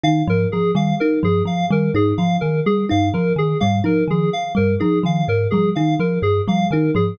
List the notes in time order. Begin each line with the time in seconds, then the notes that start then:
0.03 D#3 D#4 F5
0.27 G#2 F3 A#4
0.52 F3 G#4
0.75 D#3 G3 F5
1.00 D#4 A#4
1.23 G2 F3 G#4
1.45 F3 F5
1.71 D#3 G3 A#4
1.94 G#2 D#4 G#4
2.18 F3 F5
2.41 D#3 A#4
2.66 G3 G#4
2.89 G2 D#4 F5
3.14 F3 A#4
3.36 D#3 G#4
3.60 G#2 G3 F5
3.84 F3 D#4 A#4
4.08 D#3 F3 G#4
4.33 F5
4.55 G2 G3 A#4
4.80 F3 D#4 G#4
5.03 D#3 F3 F5
5.28 G#2 A#4
5.51 F3 G3 G#4
5.75 D#3 D#4 F5
6.00 F3 A#4
6.22 G2 G#4
6.48 F3 G3 F5
6.71 D#3 D#4 A#4
6.95 G#2 F3 G#4